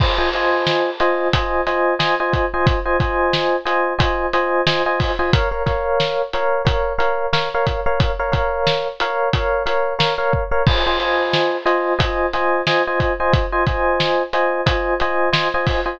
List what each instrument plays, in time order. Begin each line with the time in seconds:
0.00 electric piano 1 F4 C5 D#5 G#5, kick, crash
0.18 electric piano 1 F4 C5 D#5 G#5
0.33 electric piano 1 F4 C5 D#5 G#5, closed hi-hat
0.67 snare
1.00 electric piano 1 F4 C5 D#5 G#5, closed hi-hat
1.33 electric piano 1 F4 C5 D#5 G#5, kick, closed hi-hat
1.67 electric piano 1 F4 C5 D#5 G#5, snare, closed hi-hat
1.99 electric piano 1 F4 C5 D#5 G#5, snare
2.20 electric piano 1 F4 C5 D#5 G#5
2.33 kick, closed hi-hat
2.54 electric piano 1 F4 C5 D#5 G#5
2.67 kick, closed hi-hat
2.86 electric piano 1 F4 C5 D#5 G#5
3.00 electric piano 1 F4 C5 D#5 G#5, kick, closed hi-hat
3.33 snare
3.65 electric piano 1 F4 C5 D#5 G#5, closed hi-hat
3.98 electric piano 1 F4 C5 D#5 G#5, kick, closed hi-hat
4.33 electric piano 1 F4 C5 D#5 G#5, closed hi-hat
4.67 electric piano 1 F4 C5 D#5 G#5, snare
4.86 electric piano 1 F4 C5 D#5 G#5
5.00 kick, open hi-hat
5.19 electric piano 1 F4 C5 D#5 G#5
5.33 electric piano 1 A#4 C#5 F5, kick, closed hi-hat
5.51 electric piano 1 A#4 C#5 F5
5.66 electric piano 1 A#4 C#5 F5, kick, snare, closed hi-hat
6.00 snare
6.33 electric piano 1 A#4 C#5 F5, closed hi-hat
6.65 electric piano 1 A#4 C#5 F5, kick, closed hi-hat
6.98 electric piano 1 A#4 C#5 F5, closed hi-hat
7.33 electric piano 1 A#4 C#5 F5, snare
7.54 electric piano 1 A#4 C#5 F5
7.67 kick, closed hi-hat
7.86 electric piano 1 A#4 C#5 F5
8.00 kick, closed hi-hat
8.19 electric piano 1 A#4 C#5 F5
8.32 electric piano 1 A#4 C#5 F5, kick, closed hi-hat
8.67 snare
9.00 electric piano 1 A#4 C#5 F5, closed hi-hat
9.33 electric piano 1 A#4 C#5 F5, kick, closed hi-hat
9.66 electric piano 1 A#4 C#5 F5, closed hi-hat
9.99 electric piano 1 A#4 C#5 F5, snare
10.18 electric piano 1 A#4 C#5 F5
10.33 kick
10.51 electric piano 1 A#4 C#5 F5
10.67 electric piano 1 F4 C5 D#5 G#5, kick, crash
10.87 electric piano 1 F4 C5 D#5 G#5
11.00 electric piano 1 F4 C5 D#5 G#5, closed hi-hat
11.33 snare
11.66 electric piano 1 F4 C5 D#5 G#5, closed hi-hat
11.99 electric piano 1 F4 C5 D#5 G#5, kick, closed hi-hat
12.33 electric piano 1 F4 C5 D#5 G#5, snare, closed hi-hat
12.67 electric piano 1 F4 C5 D#5 G#5, snare
12.87 electric piano 1 F4 C5 D#5 G#5
13.00 kick, closed hi-hat
13.20 electric piano 1 F4 C5 D#5 G#5
13.33 kick, closed hi-hat
13.52 electric piano 1 F4 C5 D#5 G#5
13.67 electric piano 1 F4 C5 D#5 G#5, kick, closed hi-hat
14.00 snare
14.33 electric piano 1 F4 C5 D#5 G#5, closed hi-hat
14.66 electric piano 1 F4 C5 D#5 G#5, kick, closed hi-hat
15.00 electric piano 1 F4 C5 D#5 G#5, closed hi-hat
15.33 electric piano 1 F4 C5 D#5 G#5, snare
15.54 electric piano 1 F4 C5 D#5 G#5
15.67 kick, open hi-hat
15.86 electric piano 1 F4 C5 D#5 G#5